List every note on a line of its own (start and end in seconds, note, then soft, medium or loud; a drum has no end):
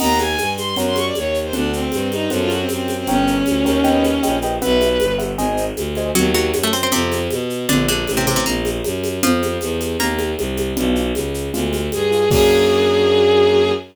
0.00 0.35 D#2 medium
0.00 0.27 A#4 medium
0.00 0.27 D#5 medium
0.00 0.27 F#5 medium
0.00 0.17 A#5 medium
0.00 crash loud
0.00 low conga loud
0.00 shaker medium
0.19 0.50 G#5 medium
0.19 high conga medium
0.19 shaker medium
0.38 0.74 G2 medium
0.38 high conga medium
0.38 shaker medium
0.58 0.75 C6 medium
0.58 high conga medium
0.58 shaker medium
0.76 1.11 F#2 medium
0.76 1.04 A#4 medium
0.76 1.04 C#5 medium
0.76 1.04 F#5 medium
0.76 low conga medium
0.76 shaker medium
0.87 0.96 C6 medium
0.96 1.05 C#6 medium
0.96 high conga medium
0.96 shaker medium
1.05 1.15 D5 medium
1.15 1.51 D#2 medium
1.15 1.39 C#5 medium
1.15 high conga medium
1.15 shaker medium
1.34 shaker medium
1.44 1.53 C5 medium
1.53 1.88 D2 medium
1.53 1.71 D4 medium
1.53 1.80 A4 medium
1.53 1.80 D5 medium
1.53 1.80 F#5 medium
1.53 low conga loud
1.53 shaker medium
1.73 2.08 C4 medium
1.73 shaker medium
1.92 2.27 G2 medium
1.92 high conga medium
1.92 shaker medium
2.12 2.30 D#4 medium
2.12 high conga medium
2.12 shaker medium
2.30 2.66 F#2 medium
2.30 2.58 A4 medium
2.30 2.58 C5 medium
2.30 2.58 F#5 medium
2.30 low conga medium
2.30 shaker medium
2.41 2.50 F4 medium
2.50 2.59 F#4 medium
2.50 high conga medium
2.50 shaker medium
2.60 2.69 C4 medium
2.69 3.04 F#2 medium
2.69 2.96 C4 medium
2.69 high conga medium
2.69 shaker medium
2.88 high conga medium
2.88 shaker medium
2.98 3.07 C4 medium
3.07 3.42 G1 medium
3.07 4.37 C#4 medium
3.07 3.35 A#4 medium
3.07 3.35 C#5 medium
3.07 3.35 G5 medium
3.07 low conga loud
3.07 shaker medium
3.27 shaker medium
3.46 3.65 D2 medium
3.46 high conga medium
3.46 shaker medium
3.64 4.18 D#2 medium
3.64 3.79 A#4 medium
3.64 3.79 C#5 medium
3.64 3.79 G5 medium
3.64 high conga medium
3.64 shaker medium
3.84 4.11 B4 medium
3.84 4.11 D#5 medium
3.84 4.11 G5 medium
3.84 low conga medium
3.84 shaker medium
4.04 high conga medium
4.04 shaker medium
4.23 4.59 A#1 medium
4.23 4.36 B4 medium
4.23 4.36 D#5 medium
4.23 4.36 G5 medium
4.23 high conga medium
4.23 shaker medium
4.42 4.56 B4 medium
4.42 4.56 D#5 medium
4.42 4.56 G5 medium
4.42 high conga medium
4.42 shaker medium
4.61 4.98 B1 medium
4.61 5.14 B4 medium
4.61 4.89 B4 medium
4.61 4.89 E5 medium
4.61 4.89 F#5 medium
4.61 low conga loud
4.61 shaker medium
4.81 high conga medium
4.81 shaker medium
5.00 5.35 G1 medium
5.00 high conga loud
5.00 shaker medium
5.19 5.32 B4 medium
5.19 5.32 E5 medium
5.19 5.32 F#5 medium
5.19 high conga medium
5.19 shaker medium
5.37 5.72 G#1 medium
5.37 5.65 C5 medium
5.37 5.65 D#5 medium
5.37 5.65 G#5 medium
5.37 low conga medium
5.37 shaker medium
5.57 shaker medium
5.76 6.11 D2 medium
5.76 high conga medium
5.76 shaker medium
5.95 6.10 C5 medium
5.95 6.10 D#5 medium
5.95 6.10 G#5 medium
5.95 high conga medium
5.95 shaker medium
6.15 6.51 D#2 loud
6.15 6.32 F#3 medium
6.15 6.32 F#4 medium
6.15 low conga loud
6.15 shaker medium
6.34 6.60 F#3 medium
6.34 6.60 F#4 medium
6.34 high conga medium
6.34 shaker medium
6.53 6.87 F#2 medium
6.53 high conga loud
6.53 shaker medium
6.63 6.73 A3 medium
6.63 6.73 A4 medium
6.73 6.82 C4 medium
6.73 6.82 C5 medium
6.73 shaker medium
6.83 6.92 C4 medium
6.83 6.92 C5 medium
6.92 7.28 F2 loud
6.92 7.19 C3 medium
6.92 7.19 C4 medium
6.92 low conga loud
6.92 shaker medium
7.12 high conga medium
7.12 shaker medium
7.31 7.66 B2 medium
7.31 high conga medium
7.31 shaker medium
7.50 shaker medium
7.69 8.04 A#1 medium
7.69 7.87 D3 medium
7.69 7.87 D4 medium
7.69 low conga loud
7.69 shaker medium
7.88 8.15 D3 medium
7.88 8.15 D4 medium
7.88 high conga medium
7.88 shaker medium
8.07 8.42 A1 medium
8.07 high conga medium
8.07 shaker medium
8.17 8.26 C3 medium
8.17 8.26 C4 medium
8.27 8.35 C3 medium
8.27 8.35 C4 medium
8.27 high conga medium
8.27 shaker medium
8.36 8.45 C3 medium
8.36 8.45 C4 medium
8.46 8.80 A#1 medium
8.46 8.70 A#3 medium
8.46 8.70 A#4 medium
8.46 low conga medium
8.46 shaker medium
8.65 high conga medium
8.65 shaker medium
8.84 9.20 F#2 medium
8.84 high conga medium
8.84 shaker medium
9.04 high conga medium
9.04 shaker medium
9.23 9.58 F2 medium
9.23 9.87 F3 medium
9.23 9.87 F4 medium
9.23 low conga loud
9.23 shaker medium
9.42 high conga medium
9.42 shaker medium
9.61 9.96 E2 medium
9.61 high conga medium
9.61 shaker medium
9.80 high conga medium
9.80 shaker medium
9.99 10.34 D#2 medium
9.99 10.31 A#3 medium
9.99 10.31 A#4 medium
9.99 low conga medium
9.99 shaker medium
10.19 high conga medium
10.19 shaker medium
10.38 10.73 C2 medium
10.38 high conga medium
10.38 shaker medium
10.57 high conga medium
10.57 shaker medium
10.77 11.12 B1 loud
10.77 11.04 B3 medium
10.77 11.04 D4 medium
10.77 11.04 F4 medium
10.77 low conga loud
10.77 shaker medium
10.95 shaker medium
11.15 11.49 C#2 medium
11.15 high conga medium
11.15 shaker medium
11.34 shaker medium
11.54 11.89 D2 medium
11.54 11.81 G#3 medium
11.54 11.81 D4 medium
11.54 11.81 F4 medium
11.54 low conga medium
11.54 shaker medium
11.73 high conga medium
11.73 shaker medium
11.92 12.28 G2 medium
11.92 12.29 G#4 medium
11.92 high conga medium
11.92 shaker medium
12.11 12.24 G#3 medium
12.11 12.24 D4 medium
12.11 12.24 F4 medium
12.11 shaker medium
12.31 13.72 F#2 medium
12.31 13.72 A#3 loud
12.31 13.72 D4 medium
12.31 13.72 F#4 medium
12.31 13.71 G#4 loud
12.31 kick loud
12.31 crash loud